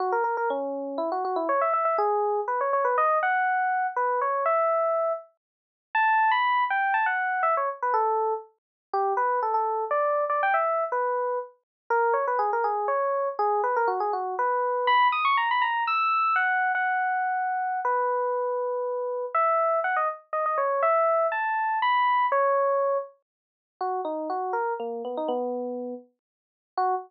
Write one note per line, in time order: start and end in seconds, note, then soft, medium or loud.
0.00 0.12 F#4 medium
0.12 0.23 A#4 medium
0.24 0.36 A#4 medium
0.37 0.49 A#4 medium
0.50 0.98 C#4 medium
0.98 1.10 E4 medium
1.12 1.24 F#4 medium
1.25 1.36 F#4 medium
1.36 1.48 E4 medium
1.49 1.61 C#5 medium
1.61 1.73 E5 medium
1.73 1.85 E5 medium
1.85 1.97 E5 medium
1.98 2.40 G#4 medium
2.48 2.60 B4 medium
2.61 2.73 C#5 medium
2.73 2.85 C#5 medium
2.85 2.96 B4 medium
2.98 3.18 D#5 medium
3.23 3.87 F#5 medium
3.96 4.20 B4 medium
4.21 4.44 C#5 medium
4.46 5.13 E5 medium
5.95 6.31 A5 medium
6.31 6.64 B5 medium
6.70 6.94 G5 medium
6.94 7.06 A5 medium
7.06 7.42 F#5 medium
7.43 7.55 E5 medium
7.57 7.69 C#5 medium
7.82 7.94 B4 medium
7.94 8.34 A4 medium
8.93 9.13 G4 medium
9.17 9.40 B4 medium
9.43 9.54 A4 medium
9.54 9.84 A4 medium
9.91 10.24 D5 medium
10.30 10.41 D5 medium
10.43 10.55 G5 medium
10.54 10.84 E5 medium
10.92 11.39 B4 medium
11.90 12.14 A#4 medium
12.14 12.25 C#5 medium
12.27 12.39 B4 medium
12.39 12.51 G#4 medium
12.53 12.65 A#4 medium
12.64 12.87 G#4 medium
12.88 13.29 C#5 medium
13.39 13.61 G#4 medium
13.64 13.75 B4 medium
13.76 13.88 A#4 medium
13.88 13.99 F#4 medium
14.00 14.12 G#4 medium
14.13 14.35 F#4 medium
14.39 14.87 B4 medium
14.87 15.08 B5 medium
15.12 15.24 D#6 medium
15.25 15.37 C#6 medium
15.37 15.49 A#5 medium
15.51 15.63 B5 medium
15.62 15.84 A#5 medium
15.87 16.35 E6 medium
16.36 16.72 F#5 medium
16.75 17.80 F#5 medium
17.85 19.25 B4 medium
19.35 19.80 E5 medium
19.84 19.96 F#5 medium
19.96 20.08 D#5 medium
20.33 20.45 D#5 medium
20.46 20.58 D#5 medium
20.58 20.82 C#5 medium
20.83 21.27 E5 medium
21.32 21.79 A5 medium
21.82 22.26 B5 medium
22.32 22.98 C#5 medium
23.81 24.01 F#4 medium
24.05 24.28 D#4 medium
24.30 24.53 F#4 medium
24.53 24.74 A#4 medium
24.80 25.02 A#3 medium
25.05 25.16 B3 medium
25.17 25.29 D#4 medium
25.28 25.94 B3 loud
26.77 26.95 F#4 loud